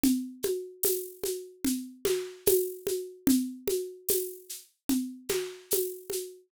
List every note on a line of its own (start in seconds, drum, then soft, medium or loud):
0.04 low conga medium
0.04 shaker medium
0.43 high conga medium
0.43 shaker medium
0.83 tambourine medium
0.83 high conga medium
0.83 shaker medium
1.24 high conga medium
1.24 shaker medium
1.65 low conga medium
1.65 shaker medium
2.05 snare medium
2.05 high conga medium
2.05 shaker medium
2.46 tambourine medium
2.46 high conga loud
2.46 shaker medium
2.87 high conga medium
2.87 shaker medium
3.27 low conga loud
3.27 shaker medium
3.68 high conga medium
3.68 shaker medium
4.09 tambourine medium
4.09 high conga medium
4.09 shaker medium
4.49 shaker medium
4.89 low conga medium
4.89 shaker medium
5.29 snare medium
5.29 high conga medium
5.29 shaker medium
5.71 tambourine medium
5.71 high conga medium
5.71 shaker medium
6.10 high conga medium
6.10 shaker medium